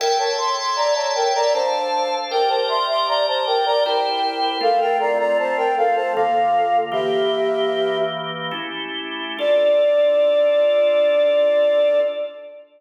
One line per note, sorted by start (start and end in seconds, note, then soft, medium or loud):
0.00 1.53 A4 medium
0.00 0.18 A#4 medium
0.00 1.53 C#5 medium
0.00 1.53 E5 medium
0.00 0.18 G5 medium
0.00 1.53 G5 medium
0.19 0.37 C#5 medium
0.19 0.37 A5 medium
0.38 0.56 C6 medium
0.57 0.76 C6 medium
0.76 0.94 D5 medium
0.76 0.94 A#5 medium
0.95 1.13 C#5 medium
0.95 1.13 A5 medium
1.15 1.34 A#4 medium
1.15 1.34 G5 medium
1.35 1.53 D5 medium
1.35 1.53 A#5 medium
1.53 2.31 D4 medium
1.53 2.31 A4 medium
1.53 2.15 C5 medium
1.53 2.31 F5 medium
1.53 2.15 A5 medium
2.31 3.83 G4 medium
2.31 2.49 A#4 medium
2.31 3.83 A#4 medium
2.31 3.83 D5 medium
2.31 2.49 G5 medium
2.49 2.67 C5 medium
2.49 2.67 A5 medium
2.68 2.87 E5 medium
2.68 2.87 C6 medium
2.89 3.07 E5 medium
2.89 3.07 C6 medium
3.08 3.26 D5 medium
3.08 3.26 A#5 medium
3.27 3.46 C5 medium
3.27 3.46 A5 medium
3.47 3.65 A#4 medium
3.47 3.65 G5 medium
3.66 3.84 D5 medium
3.66 3.84 A#5 medium
3.85 4.62 E4 medium
3.85 4.62 G4 medium
3.85 4.58 A#4 medium
3.85 4.62 C5 medium
3.85 4.58 G5 medium
4.61 6.13 A3 medium
4.61 6.13 C4 medium
4.61 6.13 F4 medium
4.61 4.80 A4 medium
4.61 4.80 F5 medium
4.80 4.99 A#4 medium
4.80 4.99 G5 medium
5.00 5.18 D5 medium
5.00 5.18 A#5 medium
5.19 5.38 D5 medium
5.19 5.38 A#5 medium
5.39 5.57 C5 medium
5.39 5.57 A5 medium
5.57 5.75 A#4 medium
5.57 5.75 G5 medium
5.77 5.95 A4 medium
5.77 5.95 F5 medium
5.96 6.14 C5 medium
5.96 6.14 A5 medium
6.15 6.93 D3 medium
6.15 6.91 A#3 medium
6.15 6.93 F4 medium
6.15 6.78 A4 medium
6.15 6.78 F5 medium
6.92 8.51 E3 medium
6.92 8.51 A#3 medium
6.92 8.51 G4 medium
6.92 7.98 G4 medium
6.92 7.98 E5 medium
8.51 9.37 A3 medium
8.51 9.37 C#4 medium
8.51 9.37 E4 medium
8.51 9.37 G4 medium
9.39 12.00 D4 loud
9.39 12.00 F4 medium
9.39 12.00 A4 loud
9.39 12.00 D5 loud